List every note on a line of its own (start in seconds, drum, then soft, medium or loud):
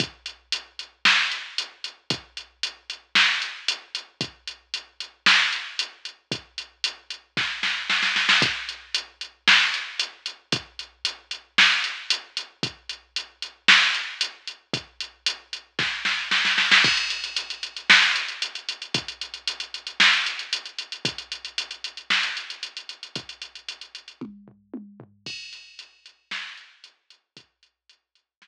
0.00 kick loud
0.00 closed hi-hat medium
0.26 closed hi-hat medium
0.52 closed hi-hat medium
0.79 closed hi-hat medium
1.05 snare medium
1.31 closed hi-hat medium
1.58 closed hi-hat medium
1.84 closed hi-hat medium
2.10 kick medium
2.10 closed hi-hat medium
2.37 closed hi-hat medium
2.63 closed hi-hat medium
2.90 closed hi-hat medium
3.15 snare medium
3.42 closed hi-hat medium
3.68 closed hi-hat loud
3.95 closed hi-hat medium
4.21 kick medium
4.21 closed hi-hat medium
4.47 closed hi-hat medium
4.74 closed hi-hat medium
5.00 closed hi-hat medium
5.26 snare loud
5.53 closed hi-hat medium
5.79 closed hi-hat medium
6.05 closed hi-hat medium
6.31 kick medium
6.31 closed hi-hat medium
6.58 closed hi-hat medium
6.84 closed hi-hat loud
7.10 closed hi-hat medium
7.37 kick medium
7.37 snare medium
7.63 snare medium
7.90 snare medium
8.03 snare medium
8.16 snare medium
8.29 snare medium
8.42 kick loud
8.42 closed hi-hat medium
8.69 closed hi-hat medium
8.95 closed hi-hat loud
9.21 closed hi-hat medium
9.48 snare loud
9.74 closed hi-hat medium
9.99 closed hi-hat medium
10.26 closed hi-hat medium
10.52 kick loud
10.52 closed hi-hat medium
10.79 closed hi-hat medium
11.05 closed hi-hat medium
11.31 closed hi-hat medium
11.58 snare medium
11.84 closed hi-hat medium
12.10 closed hi-hat loud
12.37 closed hi-hat medium
12.63 kick medium
12.63 closed hi-hat medium
12.89 closed hi-hat medium
13.16 closed hi-hat medium
13.42 closed hi-hat medium
13.68 snare loud
13.94 closed hi-hat medium
14.21 closed hi-hat loud
14.47 closed hi-hat medium
14.73 kick medium
14.73 closed hi-hat medium
15.00 closed hi-hat medium
15.26 closed hi-hat loud
15.53 closed hi-hat medium
15.79 kick medium
15.79 snare medium
16.05 snare medium
16.31 snare medium
16.45 snare medium
16.58 snare medium
16.71 snare medium
16.84 kick medium
16.84 crash medium
16.97 closed hi-hat medium
17.10 closed hi-hat medium
17.24 closed hi-hat medium
17.37 closed hi-hat medium
17.50 closed hi-hat medium
17.63 closed hi-hat medium
17.77 closed hi-hat medium
17.90 snare loud
18.03 closed hi-hat medium
18.16 closed hi-hat medium
18.28 closed hi-hat medium
18.42 closed hi-hat medium
18.55 closed hi-hat medium
18.69 closed hi-hat medium
18.82 closed hi-hat medium
18.94 kick medium
18.94 closed hi-hat medium
19.08 closed hi-hat medium
19.21 closed hi-hat medium
19.34 closed hi-hat medium
19.47 closed hi-hat medium
19.60 closed hi-hat medium
19.74 closed hi-hat medium
19.87 closed hi-hat medium
20.00 snare medium
20.13 closed hi-hat medium
20.26 closed hi-hat medium
20.39 closed hi-hat medium
20.53 closed hi-hat medium
20.65 closed hi-hat medium
20.79 closed hi-hat medium
20.92 closed hi-hat medium
21.05 kick medium
21.05 closed hi-hat medium
21.18 closed hi-hat medium
21.32 closed hi-hat medium
21.45 closed hi-hat medium
21.58 closed hi-hat medium
21.71 closed hi-hat medium
21.84 closed hi-hat medium
21.97 closed hi-hat medium
22.10 snare medium
22.23 closed hi-hat medium
22.37 closed hi-hat medium
22.50 closed hi-hat medium
22.63 closed hi-hat medium
22.77 closed hi-hat medium
22.89 closed hi-hat medium
23.03 closed hi-hat medium
23.15 kick medium
23.15 closed hi-hat medium
23.29 closed hi-hat medium
23.42 closed hi-hat medium
23.55 closed hi-hat medium
23.69 closed hi-hat medium
23.81 closed hi-hat medium
23.95 closed hi-hat medium
24.08 closed hi-hat medium
24.21 kick medium
24.21 high tom medium
24.48 floor tom medium
24.74 high tom medium
25.00 floor tom loud
25.26 kick medium
25.26 crash loud
25.53 closed hi-hat medium
25.79 closed hi-hat medium
26.06 closed hi-hat medium
26.31 snare loud
26.57 closed hi-hat medium
26.84 closed hi-hat medium
27.10 closed hi-hat medium
27.37 kick medium
27.37 closed hi-hat loud
27.63 closed hi-hat medium
27.89 closed hi-hat medium
28.15 closed hi-hat medium
28.42 snare loud